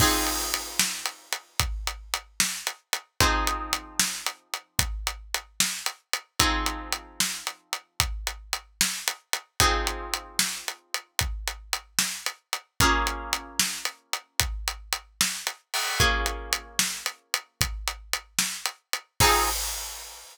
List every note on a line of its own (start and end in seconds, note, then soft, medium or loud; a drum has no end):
0.00 3.14 F3 medium
0.00 3.14 C4 medium
0.00 3.14 D#4 medium
0.00 3.14 G#4 medium
0.00 kick medium
0.00 crash loud
0.27 closed hi-hat medium
0.54 closed hi-hat medium
0.79 snare loud
1.06 closed hi-hat medium
1.33 closed hi-hat medium
1.60 kick medium
1.60 closed hi-hat medium
1.87 closed hi-hat medium
2.14 closed hi-hat medium
2.40 snare loud
2.67 closed hi-hat medium
2.93 closed hi-hat medium
3.20 6.34 F3 medium
3.20 6.34 C4 medium
3.20 6.34 D#4 medium
3.20 6.34 G#4 medium
3.20 kick loud
3.20 closed hi-hat medium
3.47 closed hi-hat medium
3.73 closed hi-hat medium
4.00 snare loud
4.26 closed hi-hat medium
4.54 closed hi-hat medium
4.79 kick medium
4.79 closed hi-hat loud
5.07 closed hi-hat medium
5.34 closed hi-hat medium
5.60 snare loud
5.86 closed hi-hat medium
6.13 closed hi-hat medium
6.39 9.53 F3 medium
6.39 9.53 C4 medium
6.39 9.53 D#4 medium
6.39 9.53 G#4 medium
6.39 kick medium
6.39 closed hi-hat loud
6.66 closed hi-hat medium
6.92 closed hi-hat medium
7.20 snare loud
7.47 closed hi-hat medium
7.73 closed hi-hat medium
8.00 kick medium
8.00 closed hi-hat medium
8.27 closed hi-hat medium
8.53 closed hi-hat medium
8.81 snare loud
9.08 closed hi-hat medium
9.33 closed hi-hat medium
9.60 12.74 F3 medium
9.60 12.74 C4 medium
9.60 12.74 D#4 medium
9.60 12.74 G#4 medium
9.60 kick loud
9.60 closed hi-hat medium
9.87 closed hi-hat medium
10.14 closed hi-hat medium
10.39 snare loud
10.68 closed hi-hat medium
10.94 closed hi-hat medium
11.19 kick medium
11.19 closed hi-hat medium
11.48 closed hi-hat medium
11.73 closed hi-hat medium
11.99 snare loud
12.26 closed hi-hat medium
12.53 closed hi-hat medium
12.80 15.95 A#3 medium
12.80 15.95 C#4 medium
12.80 15.95 F4 medium
12.80 15.95 G#4 loud
12.80 kick loud
12.80 closed hi-hat medium
13.07 closed hi-hat medium
13.33 closed hi-hat medium
13.59 snare loud
13.85 closed hi-hat medium
14.13 closed hi-hat medium
14.40 kick medium
14.40 closed hi-hat loud
14.68 closed hi-hat medium
14.93 closed hi-hat medium
15.21 snare loud
15.47 closed hi-hat medium
15.74 open hi-hat medium
16.00 19.14 A#3 medium
16.00 19.14 C#4 medium
16.00 19.14 F4 medium
16.00 19.14 G#4 medium
16.00 kick loud
16.00 closed hi-hat medium
16.26 closed hi-hat medium
16.53 closed hi-hat medium
16.79 snare loud
17.06 closed hi-hat medium
17.34 closed hi-hat medium
17.61 kick medium
17.61 closed hi-hat loud
17.88 closed hi-hat medium
18.13 closed hi-hat medium
18.39 snare loud
18.66 closed hi-hat medium
18.93 closed hi-hat medium
19.20 19.49 F3 loud
19.20 19.49 C4 loud
19.20 19.49 D#4 loud
19.20 19.49 G#4 loud
19.20 kick loud
19.20 crash loud